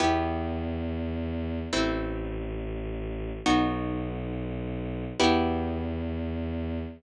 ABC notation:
X:1
M:3/4
L:1/8
Q:1/4=104
K:Em
V:1 name="Orchestral Harp"
[B,EG]6 | [A,CE]6 | [B,^DF]6 | [B,EG]6 |]
V:2 name="Violin" clef=bass
E,,6 | A,,,6 | B,,,6 | E,,6 |]